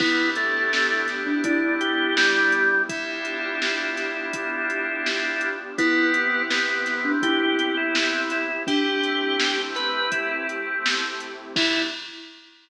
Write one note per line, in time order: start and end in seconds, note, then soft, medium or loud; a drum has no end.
0.00 1.33 E2 medium
0.00 0.30 B3 loud
0.00 2.86 B3 medium
0.00 2.61 B3 loud
0.00 2.86 D4 medium
0.00 2.61 D4 loud
0.00 0.29 E4 loud
0.00 2.86 E4 medium
0.00 2.61 E4 loud
0.00 2.86 G4 medium
0.00 2.61 G4 loud
0.00 kick loud
0.00 crash medium
0.36 1.06 A3 loud
0.36 closed hi-hat medium
0.73 snare medium
1.08 snare soft
1.08 closed hi-hat medium
1.27 1.44 D4 loud
1.44 2.77 E2 medium
1.44 1.75 D4 loud
1.44 2.77 E4 loud
1.44 kick medium
1.44 closed hi-hat medium
1.81 2.15 G4 loud
1.81 closed hi-hat medium
2.17 2.82 G3 loud
2.17 snare loud
2.52 closed hi-hat medium
2.89 4.22 G1 medium
2.89 5.75 B3 medium
2.89 5.51 B3 loud
2.89 5.75 D4 medium
2.89 5.51 D4 loud
2.89 5.49 E4 medium
2.89 5.75 F4 medium
2.89 5.51 F4 loud
2.89 5.75 G4 medium
2.89 5.51 G4 loud
2.89 kick medium
2.89 closed hi-hat medium
3.25 closed hi-hat medium
3.62 snare medium
3.97 snare soft
3.97 closed hi-hat medium
4.33 5.66 G1 medium
4.33 kick medium
4.33 closed hi-hat medium
4.70 closed hi-hat medium
5.06 snare medium
5.41 closed hi-hat medium
5.78 7.11 C2 medium
5.78 8.38 B3 loud
5.78 6.42 B3 loud
5.78 8.65 B3 medium
5.78 8.38 C4 loud
5.78 8.65 C4 medium
5.78 8.38 E4 loud
5.78 6.11 E4 loud
5.78 8.65 E4 medium
5.78 8.38 G4 loud
5.78 8.65 G4 medium
5.78 kick medium
5.78 closed hi-hat medium
6.14 closed hi-hat medium
6.50 7.12 B3 loud
6.50 snare medium
6.86 snare soft
6.86 closed hi-hat medium
7.05 7.22 D4 loud
7.22 8.56 C2 medium
7.22 8.47 E4 loud
7.22 7.75 G4 loud
7.22 kick medium
7.22 closed hi-hat medium
7.59 closed hi-hat medium
7.77 8.22 E4 medium
7.95 snare loud
8.30 8.63 E4 loud
8.30 snare soft
8.30 closed hi-hat medium
8.67 10.00 A1 medium
8.67 11.27 A3 loud
8.67 11.54 A3 medium
8.67 11.27 C4 loud
8.67 11.54 C4 medium
8.67 9.56 D4 loud
8.67 11.27 E4 loud
8.67 11.54 E4 medium
8.67 11.27 G4 loud
8.67 9.61 G4 loud
8.67 11.54 G4 medium
8.67 kick medium
8.67 closed hi-hat medium
9.03 closed hi-hat medium
9.40 snare loud
9.75 10.11 B4 loud
9.75 snare soft
9.75 closed hi-hat medium
10.12 11.45 A1 medium
10.12 10.47 E4 medium
10.12 kick medium
10.12 closed hi-hat medium
10.49 closed hi-hat medium
10.86 snare loud
11.20 closed hi-hat medium
11.55 11.81 E2 loud
11.55 11.81 B3 loud
11.55 11.82 B3 loud
11.55 11.81 D4 loud
11.55 11.82 D4 loud
11.55 11.81 E4 loud
11.55 11.82 E4 loud
11.55 11.81 G4 loud
11.55 11.82 G4 loud
11.55 kick loud
11.55 crash loud